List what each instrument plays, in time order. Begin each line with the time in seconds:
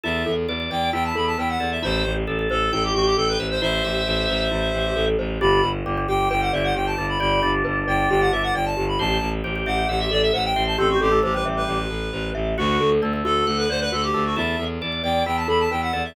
0.04 violin E2, glockenspiel E4, drawbar organ A4, clarinet E5
0.26 violin E2, glockenspiel A4
0.48 violin E2, glockenspiel B4, drawbar organ D5
0.60 drawbar organ D5
0.71 violin E2, glockenspiel D5, drawbar organ D5, clarinet G5
0.93 violin E2, glockenspiel E4, drawbar organ E4, clarinet G5
1.05 clarinet A5
1.15 violin E2, glockenspiel A4, clarinet B5
1.27 clarinet A5
1.38 violin E2, glockenspiel B4, clarinet G5
1.49 clarinet F#5
1.60 violin E2, drawbar organ A4, glockenspiel D5
1.72 clarinet E5
1.82 violin A1, glockenspiel E4, clarinet C5, drawbar organ E5
2.05 violin A1, glockenspiel G4
2.27 violin A1, drawbar organ A4, glockenspiel A4
2.39 drawbar organ A4
2.50 violin A1, drawbar organ A4, clarinet A4, glockenspiel C5
2.72 violin A1, glockenspiel E4, clarinet A4, drawbar organ G5
2.84 clarinet G4
2.94 violin A1, clarinet F#4, glockenspiel G4
3.06 clarinet G4
3.17 violin A1, glockenspiel A4, clarinet A4
3.28 clarinet B4
3.39 violin A1, glockenspiel C5, drawbar organ E5
3.51 clarinet C5
3.61 violin A1, glockenspiel E4, drawbar organ C5, clarinet C5 E5
3.73 drawbar organ C5
3.84 violin A1, glockenspiel G4, drawbar organ E5
4.07 violin A1, glockenspiel A4
4.29 violin A1, glockenspiel C5
4.51 violin A1, glockenspiel E4
4.74 violin A1, glockenspiel G4
4.96 violin A1, glockenspiel A4
5.19 violin A1, glockenspiel C5
5.41 violin G1, drawbar organ D4, glockenspiel G4, clarinet B5
5.63 violin G1, glockenspiel B4
5.86 violin G1, drawbar organ G3, glockenspiel D5
5.97 drawbar organ G3
6.08 violin G1, drawbar organ G3, glockenspiel G4, clarinet G5
6.31 violin G1, drawbar organ G4, glockenspiel B4, clarinet G5
6.42 clarinet F#5
6.53 violin G1, glockenspiel D5, clarinet E5
6.64 clarinet F#5
6.75 violin G1, glockenspiel G4, clarinet G5
6.86 clarinet A5
6.98 violin G1, drawbar organ D4, glockenspiel B4
7.09 clarinet B5
7.20 violin G1, drawbar organ G4, glockenspiel D5, clarinet B5
7.42 violin G1, drawbar organ D4, glockenspiel G4
7.64 violin G1, glockenspiel B4
7.87 violin G1, glockenspiel D5, clarinet G5
8.10 violin G1, glockenspiel G4, clarinet G5
8.21 clarinet F#5
8.32 violin G1, glockenspiel B4, clarinet E5
8.43 clarinet F#5
8.55 violin G1, glockenspiel D5, clarinet G5
8.66 clarinet A5
8.77 violin G1, glockenspiel G4
8.88 clarinet B5
8.99 violin A1, glockenspiel G4, drawbar organ C5, clarinet A5
9.22 violin A1, glockenspiel A4
9.44 violin A1, drawbar organ G4, glockenspiel C5
9.56 drawbar organ G4
9.66 violin A1, drawbar organ G4, glockenspiel E5, clarinet F#5
9.89 violin A1, glockenspiel G4, drawbar organ E5, clarinet F#5
10.00 clarinet E5
10.11 violin A1, glockenspiel A4, clarinet D5
10.22 clarinet E5
10.33 violin A1, glockenspiel C5, clarinet F#5
10.45 clarinet G5
10.56 violin A1, drawbar organ C5, glockenspiel E5
10.67 clarinet A5
10.78 violin A1, drawbar organ C4, glockenspiel G4, clarinet A4
10.90 clarinet F#4
11.01 violin A1, clarinet G4, glockenspiel A4
11.12 drawbar organ A3
11.23 violin A1, drawbar organ A3, clarinet G4, glockenspiel C5
11.34 drawbar organ G3, clarinet B4
11.45 violin A1, glockenspiel E5
11.57 clarinet B4
11.68 violin A1, glockenspiel G4
11.90 violin A1, glockenspiel A4
12.13 violin A1, glockenspiel C5
12.35 violin A1, glockenspiel E5
12.58 violin D2, clarinet F#4, drawbar organ F#4, glockenspiel F#4
12.79 violin D2, glockenspiel A4
13.02 violin D2, drawbar organ A3, glockenspiel D5
13.13 drawbar organ A3
13.24 violin D2, drawbar organ A3, glockenspiel F#4, clarinet A4
13.47 violin D2, clarinet A4, glockenspiel A4, drawbar organ F#5
13.58 clarinet B4
13.69 violin D2, clarinet C5, glockenspiel D5
13.81 clarinet B4
13.92 violin D2, glockenspiel F#4, clarinet A4
14.03 clarinet G4
14.14 violin D2, drawbar organ A3, glockenspiel A4
14.26 clarinet F#4
14.36 violin E2, glockenspiel E4, drawbar organ A4, clarinet E5
14.59 violin E2, glockenspiel A4
14.81 violin E2, glockenspiel B4, drawbar organ D5
14.92 drawbar organ D5
15.04 violin E2, glockenspiel D5, drawbar organ D5, clarinet G5
15.26 violin E2, glockenspiel E4, drawbar organ E4, clarinet G5
15.37 clarinet A5
15.48 violin E2, glockenspiel A4, clarinet B5
15.60 clarinet A5
15.71 violin E2, glockenspiel B4, clarinet G5
15.82 clarinet F#5
15.93 violin E2, drawbar organ A4, glockenspiel D5
16.05 clarinet E5